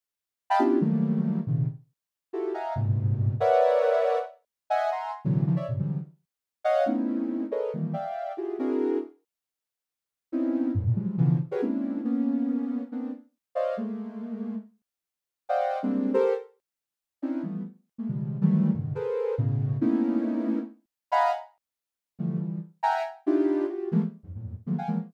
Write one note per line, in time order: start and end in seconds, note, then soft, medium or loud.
0.50 0.60 D#5 loud
0.50 0.60 F5 loud
0.50 0.60 G5 loud
0.50 0.60 A5 loud
0.50 0.60 B5 loud
0.59 0.79 B3 medium
0.59 0.79 C#4 medium
0.59 0.79 D4 medium
0.59 0.79 E4 medium
0.59 0.79 F4 medium
0.59 0.79 G4 medium
0.81 1.39 D#3 medium
0.81 1.39 F3 medium
0.81 1.39 F#3 medium
0.81 1.39 G3 medium
0.81 1.39 A3 medium
0.81 1.39 A#3 medium
1.47 1.66 A#2 medium
1.47 1.66 C3 medium
1.47 1.66 C#3 medium
1.47 1.66 D#3 medium
2.33 2.52 E4 medium
2.33 2.52 F4 medium
2.33 2.52 F#4 medium
2.33 2.52 G4 medium
2.33 2.52 A4 medium
2.54 2.73 D#5 medium
2.54 2.73 E5 medium
2.54 2.73 F5 medium
2.54 2.73 F#5 medium
2.54 2.73 G#5 medium
2.54 2.73 A#5 medium
2.76 3.34 G2 medium
2.76 3.34 G#2 medium
2.76 3.34 A#2 medium
2.76 3.34 B2 medium
2.76 3.34 C3 medium
3.40 4.18 A#4 loud
3.40 4.18 B4 loud
3.40 4.18 C#5 loud
3.40 4.18 D5 loud
3.40 4.18 E5 loud
3.40 4.18 F#5 loud
4.70 4.89 D#5 loud
4.70 4.89 E5 loud
4.70 4.89 F#5 loud
4.70 4.89 G#5 loud
4.92 5.11 E5 medium
4.92 5.11 F#5 medium
4.92 5.11 G#5 medium
4.92 5.11 A#5 medium
4.92 5.11 C6 medium
5.25 5.44 A#2 loud
5.25 5.44 C3 loud
5.25 5.44 D3 loud
5.25 5.44 E3 loud
5.25 5.44 F#3 loud
5.46 5.56 C#3 loud
5.46 5.56 D#3 loud
5.46 5.56 E3 loud
5.46 5.56 F3 loud
5.56 5.66 C#5 medium
5.56 5.66 D5 medium
5.56 5.66 E5 medium
5.68 5.78 G2 medium
5.68 5.78 G#2 medium
5.68 5.78 A#2 medium
5.68 5.78 B2 medium
5.68 5.78 C3 medium
5.68 5.78 C#3 medium
5.79 5.98 C3 medium
5.79 5.98 D3 medium
5.79 5.98 E3 medium
5.79 5.98 F3 medium
5.79 5.98 F#3 medium
5.79 5.98 G3 medium
6.64 6.84 C#5 loud
6.64 6.84 D#5 loud
6.64 6.84 F5 loud
6.64 6.84 F#5 loud
6.86 7.44 A3 medium
6.86 7.44 B3 medium
6.86 7.44 C4 medium
6.86 7.44 C#4 medium
6.86 7.44 D#4 medium
6.86 7.44 E4 medium
7.51 7.71 G#4 medium
7.51 7.71 A4 medium
7.51 7.71 A#4 medium
7.51 7.71 B4 medium
7.51 7.71 C#5 medium
7.51 7.71 D#5 medium
7.74 7.93 D#3 medium
7.74 7.93 E3 medium
7.74 7.93 F3 medium
7.74 7.93 G3 medium
7.74 7.93 A3 medium
7.74 7.93 A#3 medium
7.93 8.32 D5 medium
7.93 8.32 E5 medium
7.93 8.32 F5 medium
7.93 8.32 G5 medium
8.37 8.57 E4 medium
8.37 8.57 F4 medium
8.37 8.57 F#4 medium
8.37 8.57 G4 medium
8.37 8.57 G#4 medium
8.59 8.98 C4 medium
8.59 8.98 D4 medium
8.59 8.98 E4 medium
8.59 8.98 F#4 medium
8.59 8.98 G#4 medium
8.59 8.98 A#4 medium
10.32 10.71 B3 medium
10.32 10.71 C4 medium
10.32 10.71 C#4 medium
10.32 10.71 D#4 medium
10.32 10.71 E4 medium
10.75 10.84 F2 medium
10.75 10.84 F#2 medium
10.75 10.84 G2 medium
10.75 10.84 A2 medium
10.86 10.96 A2 medium
10.86 10.96 A#2 medium
10.86 10.96 B2 medium
10.96 11.16 E3 medium
10.96 11.16 F3 medium
10.96 11.16 F#3 medium
10.96 11.16 G3 medium
10.96 11.16 G#3 medium
11.18 11.37 B2 loud
11.18 11.37 C#3 loud
11.18 11.37 D3 loud
11.18 11.37 E3 loud
11.18 11.37 F3 loud
11.51 11.61 F#4 medium
11.51 11.61 G4 medium
11.51 11.61 G#4 medium
11.51 11.61 A#4 medium
11.51 11.61 B4 medium
11.51 11.61 C#5 medium
11.62 12.01 G#3 medium
11.62 12.01 A#3 medium
11.62 12.01 C4 medium
11.62 12.01 C#4 medium
11.62 12.01 D4 medium
11.62 12.01 E4 medium
12.05 12.82 A#3 medium
12.05 12.82 B3 medium
12.05 12.82 C#4 medium
12.92 13.11 A#3 medium
12.92 13.11 B3 medium
12.92 13.11 C4 medium
12.92 13.11 D4 medium
13.55 13.75 C5 medium
13.55 13.75 C#5 medium
13.55 13.75 D5 medium
13.55 13.75 D#5 medium
13.55 13.75 F5 medium
13.77 14.55 G#3 medium
13.77 14.55 A3 medium
13.77 14.55 A#3 medium
15.49 15.78 C5 medium
15.49 15.78 D5 medium
15.49 15.78 D#5 medium
15.49 15.78 F5 medium
15.49 15.78 F#5 medium
15.49 15.78 G5 medium
15.83 16.12 G3 medium
15.83 16.12 G#3 medium
15.83 16.12 A#3 medium
15.83 16.12 C4 medium
15.83 16.12 D4 medium
16.14 16.33 G4 loud
16.14 16.33 A4 loud
16.14 16.33 A#4 loud
16.14 16.33 C5 loud
17.22 17.42 C4 medium
17.22 17.42 C#4 medium
17.22 17.42 D4 medium
17.22 17.42 D#4 medium
17.22 17.42 E4 medium
17.43 17.63 E3 medium
17.43 17.63 F3 medium
17.43 17.63 G3 medium
17.43 17.63 A3 medium
17.43 17.63 B3 medium
17.98 18.08 G#3 medium
17.98 18.08 A3 medium
17.98 18.08 A#3 medium
18.08 18.38 B2 medium
18.08 18.38 C#3 medium
18.08 18.38 D#3 medium
18.08 18.38 F3 medium
18.08 18.38 G3 medium
18.08 18.38 G#3 medium
18.41 18.71 D#3 loud
18.41 18.71 E3 loud
18.41 18.71 F#3 loud
18.41 18.71 G3 loud
18.41 18.71 A3 loud
18.74 18.93 G2 medium
18.74 18.93 A2 medium
18.74 18.93 B2 medium
18.74 18.93 C#3 medium
18.74 18.93 D3 medium
18.74 18.93 D#3 medium
18.95 19.34 G#4 medium
18.95 19.34 A4 medium
18.95 19.34 A#4 medium
18.95 19.34 B4 medium
18.95 19.34 C5 medium
19.38 19.77 A2 loud
19.38 19.77 B2 loud
19.38 19.77 C#3 loud
19.81 20.59 A3 medium
19.81 20.59 A#3 medium
19.81 20.59 B3 medium
19.81 20.59 C#4 medium
19.81 20.59 D#4 medium
19.81 20.59 E4 medium
21.12 21.31 D#5 loud
21.12 21.31 F5 loud
21.12 21.31 F#5 loud
21.12 21.31 G#5 loud
21.12 21.31 A#5 loud
21.12 21.31 B5 loud
22.19 22.38 D3 medium
22.19 22.38 E3 medium
22.19 22.38 F3 medium
22.19 22.38 G3 medium
22.19 22.38 A3 medium
22.40 22.59 D3 medium
22.40 22.59 E3 medium
22.40 22.59 F3 medium
22.40 22.59 G3 medium
22.83 23.02 E5 loud
22.83 23.02 F#5 loud
22.83 23.02 G5 loud
22.83 23.02 G#5 loud
22.83 23.02 A#5 loud
23.26 23.65 D4 medium
23.26 23.65 D#4 medium
23.26 23.65 E4 medium
23.26 23.65 F4 medium
23.26 23.65 G4 medium
23.69 23.89 F4 medium
23.69 23.89 F#4 medium
23.69 23.89 G4 medium
23.92 24.01 E3 loud
23.92 24.01 F3 loud
23.92 24.01 G3 loud
23.92 24.01 G#3 loud
23.92 24.01 A3 loud
23.92 24.01 A#3 loud
24.23 24.33 E2 medium
24.23 24.33 F#2 medium
24.23 24.33 G#2 medium
24.35 24.54 E2 soft
24.35 24.54 F2 soft
24.35 24.54 G2 soft
24.35 24.54 A2 soft
24.35 24.54 A#2 soft
24.66 24.76 D#3 medium
24.66 24.76 F3 medium
24.66 24.76 F#3 medium
24.66 24.76 G#3 medium
24.66 24.76 A3 medium
24.66 24.76 A#3 medium
24.78 24.88 F5 medium
24.78 24.88 F#5 medium
24.78 24.88 G5 medium
24.78 24.88 G#5 medium
24.88 24.98 E3 medium
24.88 24.98 F3 medium
24.88 24.98 F#3 medium
24.88 24.98 G#3 medium
24.88 24.98 A#3 medium